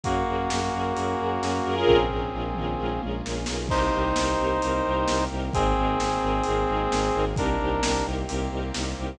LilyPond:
<<
  \new Staff \with { instrumentName = "Brass Section" } { \time 4/4 \key bes \minor \tempo 4 = 131 <bes ges'>1 | <c' aes'>2. r4 | \key c \minor <ees' c''>1 | <c' aes'>1 |
<d' bes'>4. r2 r8 | }
  \new Staff \with { instrumentName = "String Ensemble 1" } { \time 4/4 \key bes \minor <des' ges' aes' bes'>8 <des' ges' aes' bes'>8 <des' ges' aes' bes'>8 <des' ges' aes' bes'>8 <des' ges' aes' bes'>8 <des' ges' aes' bes'>8 <des' ges' aes' bes'>8 <des' f' aes' bes'>8~ | <des' f' aes' bes'>8 <des' f' aes' bes'>8 <des' f' aes' bes'>8 <des' f' aes' bes'>8 <des' f' aes' bes'>8 <des' f' aes' bes'>8 <des' f' aes' bes'>8 <des' f' aes' bes'>8 | \key c \minor <c' ees' g' bes'>8 <c' ees' g' bes'>8 <c' ees' g' bes'>8 <c' ees' g' bes'>8 <c' ees' g' bes'>8 <c' ees' g' bes'>8 <c' ees' g' bes'>8 <c' ees' g' bes'>8 | <c' ees' aes' bes'>8 <c' ees' aes' bes'>8 <c' ees' aes' bes'>8 <c' ees' aes' bes'>8 <c' ees' aes' bes'>8 <c' ees' aes' bes'>8 <c' ees' aes' bes'>8 <c' ees' aes' bes'>8 |
<c' ees' g' bes'>8 <c' ees' g' bes'>8 <c' ees' g' bes'>8 <c' ees' g' bes'>8 <c' ees' g' bes'>8 <c' ees' g' bes'>8 <c' ees' g' bes'>8 <c' ees' g' bes'>8 | }
  \new Staff \with { instrumentName = "Violin" } { \clef bass \time 4/4 \key bes \minor ges,8 ges,8 ges,8 ges,8 ges,8 ges,8 ges,8 ges,8 | bes,,8 bes,,8 bes,,8 bes,,8 bes,,8 bes,,8 bes,,8 b,,8 | \key c \minor c,8 c,8 c,8 c,8 c,8 c,8 c,8 c,8 | aes,,8 aes,,8 aes,,8 aes,,8 aes,,8 aes,,8 aes,,8 aes,,8 |
c,8 c,8 c,8 c,8 c,8 c,8 c,8 c,8 | }
  \new Staff \with { instrumentName = "Brass Section" } { \time 4/4 \key bes \minor <bes des' ges' aes'>2 <bes des' aes' bes'>2 | <bes des' f' aes'>1 | \key c \minor <bes c' ees' g'>2 <bes c' g' bes'>2 | <bes c' ees' aes'>2 <aes bes c' aes'>2 |
<bes c' ees' g'>2 <bes c' g' bes'>2 | }
  \new DrumStaff \with { instrumentName = "Drums" } \drummode { \time 4/4 <hh bd>4 sn4 hh4 sn4 | <bd tomfh>8 tomfh8 r8 toml8 tommh8 tommh8 sn8 sn8 | <cymc bd>4 sn4 hh4 sn4 | <hh bd>4 sn4 hh4 sn4 |
<hh bd>4 sn4 hh4 sn4 | }
>>